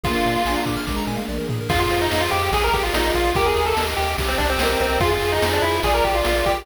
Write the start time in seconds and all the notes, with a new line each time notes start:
0.04 A#1 A#3 D4 F4 G#4, kick, ride
0.15 A#4
0.25 A#2 D5, ride
0.35 F5
0.45 A#1 D4 G#5, snare
0.56 A#5
0.66 A#2 D6, kick, ride
0.77 F6
0.87 A#1 G#3 A#3 D4 G#4 A#4 D6, kick, snare
0.96 A#5
1.07 A#2 G#5, high tom
1.17 F5
1.29 A#1 D5, mid tom
1.38 A#4
1.49 A#2 G#4, floor tom
1.61 A#4
1.69 F2 F4 G#4, kick, crash
1.80 F4
1.90 F2 C5, ride
2.01 D#4
2.11 F2 F5, snare
2.21 F4
2.31 F2 G4 G#4, ride
2.52 A#1 G#4, kick, ride
2.64 A#4
2.73 A#1 G4 A#4, kick, ride
2.83 F4
2.92 A#1 D#4 F4 D5, snare
3.14 A#1 F4 F5, kick, ride
3.34 D#2 G4 A#4, kick, ride
3.46 G#4
3.56 D#2 A#4, ride
3.66 A4
3.77 D#2 D#5, snare
3.97 D#2 G4, ride
4.18 C2 G4, kick, ride
4.28 C4
4.38 C2 D4 C5, kick, ride
4.50 C4
4.58 C2 C4 A#4 D#5, snare
4.79 C2 C4 G4, kick, ride
5.00 F2 F4 G#4, kick, ride
5.12 F4
5.21 F2 G#4, ride
5.32 D#4
5.42 F2 C5, snare
5.53 D4
5.62 F2 E4 F4, ride
5.83 A#1 F4 G#4 D5, kick, ride
5.94 A#4
6.04 A#1 G4 G#4, kick, ride
6.15 F4
6.25 A#1 F4 A#4, snare
6.45 A#1 G4 D5, kick, ride